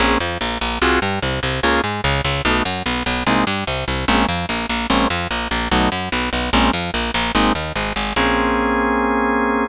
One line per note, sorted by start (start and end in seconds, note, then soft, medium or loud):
0.00 0.17 A#1 loud
0.00 0.18 A#3 loud
0.00 0.18 C4 medium
0.00 0.18 C#4 loud
0.00 0.18 G#4 loud
0.20 0.38 F2 medium
0.20 0.38 F3 medium
0.41 0.58 A#1 medium
0.41 0.58 A#3 medium
0.61 0.79 A#1 medium
0.61 0.79 A#3 medium
0.82 0.99 C2 loud
0.82 1.00 C4 loud
0.82 1.00 F4 loud
0.82 1.00 F#4 loud
0.82 1.00 G#4 loud
1.02 1.19 G2 loud
1.02 1.19 G3 medium
1.22 1.40 C2 medium
1.22 1.40 C3 medium
1.43 1.60 C2 loud
1.43 1.60 C3 medium
1.63 1.81 C#2 loud
1.63 1.82 A#3 loud
1.63 1.82 C#4 loud
1.63 1.82 F4 loud
1.63 1.82 G#4 loud
1.84 2.01 G#2 medium
1.84 2.01 G#3 medium
2.04 2.21 C#2 loud
2.04 2.21 C#3 loud
2.24 2.42 C#2 loud
2.24 2.42 C#3 medium
2.45 2.62 B1 loud
2.45 2.63 A3 medium
2.45 2.63 B3 medium
2.45 2.63 D#4 loud
2.45 2.63 F#4 medium
2.65 2.83 F#2 medium
2.65 2.83 F#3 medium
2.86 3.03 B1 medium
2.86 3.03 B3 medium
3.06 3.23 B1 loud
3.06 3.24 B3 medium
3.27 3.44 C2 loud
3.27 3.45 G#3 loud
3.27 3.45 A#3 loud
3.27 3.45 C4 loud
3.27 3.45 D#4 loud
3.47 3.64 G2 loud
3.47 3.64 G3 medium
3.67 3.85 C2 medium
3.67 3.85 C3 medium
3.88 4.05 C2 medium
3.88 4.05 C3 medium
4.08 4.26 A#1 loud
4.08 4.26 G#3 loud
4.08 4.26 A#3 loud
4.08 4.26 C4 loud
4.08 4.26 C#4 medium
4.28 4.46 F2 medium
4.28 4.46 F3 medium
4.49 4.66 A#1 medium
4.49 4.66 A#3 medium
4.69 4.87 A#1 medium
4.69 4.87 A#3 medium
4.90 5.07 A#1 loud
4.90 5.08 G#3 loud
4.90 5.08 A#3 loud
4.90 5.08 C4 loud
4.90 5.08 C#4 loud
5.10 5.28 F2 medium
5.10 5.28 F3 medium
5.31 5.48 A#1 medium
5.31 5.48 A#3 medium
5.51 5.68 A#1 medium
5.51 5.68 A#3 medium
5.71 5.89 B1 loud
5.71 5.90 F#3 loud
5.71 5.90 A3 loud
5.71 5.90 B3 loud
5.71 5.90 D#4 medium
5.92 6.09 F#2 medium
5.92 6.09 F#3 medium
6.12 6.30 B1 loud
6.12 6.30 B3 medium
6.33 6.50 B1 medium
6.33 6.50 B3 medium
6.53 6.70 A#1 loud
6.53 6.71 G#3 loud
6.53 6.71 A#3 loud
6.53 6.71 C4 loud
6.53 6.71 C#4 loud
6.73 6.91 F2 medium
6.73 6.91 F3 medium
6.94 7.11 A#1 loud
6.94 7.11 A#3 medium
7.14 7.32 A#1 loud
7.14 7.32 A#3 loud
7.35 7.52 G#1 loud
7.35 7.53 G#3 loud
7.35 7.53 A#3 loud
7.35 7.53 C4 loud
7.35 7.53 D#4 loud
7.55 7.72 D#2 medium
7.55 7.73 D#3 medium
7.75 7.93 G#1 medium
7.75 7.93 G#3 medium
7.96 8.13 G#1 medium
7.96 8.13 G#3 medium
8.16 9.67 A#1 loud
8.16 9.67 A#3 loud
8.16 9.67 C4 loud
8.16 9.67 C#4 medium
8.16 9.67 G#4 loud